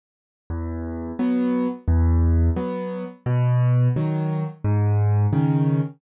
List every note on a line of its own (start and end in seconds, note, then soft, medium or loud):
0.50 1.12 E2 loud
1.19 1.68 F#3 medium
1.19 1.68 B3 medium
1.88 2.50 E2 loud
2.56 3.05 F#3 medium
2.56 3.05 B3 medium
3.26 3.88 B2 loud
3.96 4.45 D#3 medium
3.96 4.45 F#3 medium
4.65 5.27 G#2 loud
5.33 5.81 C#3 medium
5.33 5.81 D#3 medium